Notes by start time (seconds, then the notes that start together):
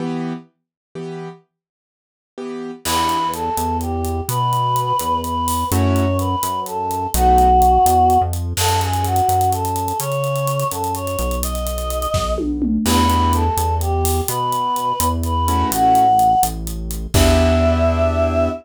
0.00 E3 B3 G4
0.95 E3 B3 G4
2.38 E3 B3 G4
2.85 E2 B3 D4 E4 G4 B4, crash
3.09 closed hi-hat
3.33 A4, closed hi-hat
3.57 E2, closed hi-hat
3.81 G4, closed hi-hat
4.05 closed hi-hat
4.29 B2 B4, closed hi-hat
4.53 closed hi-hat
4.76 closed hi-hat
4.99 E2, closed hi-hat
5.24 B4, closed hi-hat
5.48 open hi-hat
5.71 F#2 A3 C#4 E4 F#4 C#5, closed hi-hat
5.96 closed hi-hat
6.19 B4, closed hi-hat
6.43 F#2, closed hi-hat
6.66 A4, closed hi-hat
6.91 closed hi-hat
7.14 B1 A3 B3 D#4 F#4, closed hi-hat
7.38 closed hi-hat
7.62 closed hi-hat
7.86 E2, closed hi-hat
8.10 closed hi-hat
8.21 F2
8.33 closed hi-hat
8.57 F#2 A4, crash
8.69 closed hi-hat
8.81 G#4, closed hi-hat
8.93 closed hi-hat
9.04 F#4, closed hi-hat
9.16 closed hi-hat
9.29 F#2, closed hi-hat
9.41 closed hi-hat
9.52 A4, closed hi-hat
9.65 closed hi-hat
9.76 closed hi-hat
9.88 closed hi-hat
10.00 C#3 C#5, closed hi-hat
10.12 closed hi-hat
10.24 closed hi-hat
10.36 closed hi-hat
10.47 closed hi-hat
10.60 closed hi-hat
10.71 F#2 A4, closed hi-hat
10.84 closed hi-hat
10.95 C#5, closed hi-hat
11.07 closed hi-hat
11.19 B1, closed hi-hat
11.31 closed hi-hat
11.43 D#5, closed hi-hat
11.55 closed hi-hat
11.67 closed hi-hat
11.78 closed hi-hat
11.90 closed hi-hat
12.02 closed hi-hat
12.14 B1, kick, snare
12.38 high tom
12.62 mid tom
12.86 E2 B3 D4 E4 G4 B4, crash
13.10 B3 D4 E4 G4, closed hi-hat
13.33 A4, closed hi-hat
13.57 E2, closed hi-hat
13.81 G4, closed hi-hat
14.05 open hi-hat
14.28 B2 B4, closed hi-hat
14.52 closed hi-hat
14.76 closed hi-hat
15.00 E2, closed hi-hat
15.23 B4, closed hi-hat
15.48 A3 C#4 E4 F#4, closed hi-hat
15.72 A1 F#5, closed hi-hat
15.95 closed hi-hat
16.19 closed hi-hat
16.43 A1, closed hi-hat
16.67 closed hi-hat
16.91 closed hi-hat
17.14 E2 B3 D4 E4 G4 E5, kick, crash